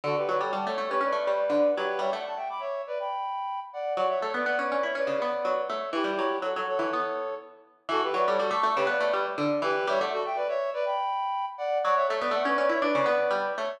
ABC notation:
X:1
M:4/4
L:1/16
Q:1/4=122
K:D
V:1 name="Clarinet"
[FA] [GB] [Bd] [Ac] [fa] [Ac]2 [GB] [Bd]6 [GB]2 | [ce] [df] [fa] [eg] [bd'] [ce]2 [Bd] [gb]6 [df]2 | [df] [ce] [Ac] [Bd] [df] [Bd]2 [ce] [Bd]6 [ce]2 | [EG]4 [FA] [Ac] [Ac]6 z4 |
[FA] [GB] [Bd] [Ac] [FA] [ac']2 [GB] [Bd]3 z3 [GB]2 | [ce] [df] [FA] [eg] [Bd] [ce]2 [Bd] [gb]6 [df]2 | [df] [ce] [Ac] [Bd] [df] [Bd]2 [ce] [Bd]6 [ce]2 |]
V:2 name="Harpsichord"
D,2 F, G, G, A, A, C C A, G,2 D,2 F,2 | G, A,11 z4 | F,2 A, B, B, C C E C C, B,2 F,2 A,2 | E, G, F,2 F, F,2 E, B,6 z2 |
E,2 F, G, G, A, A, C, B, A, G,2 D,2 E,2 | G, A,11 z4 | F,2 A, B, A, C C E D C, B,2 G,2 A,2 |]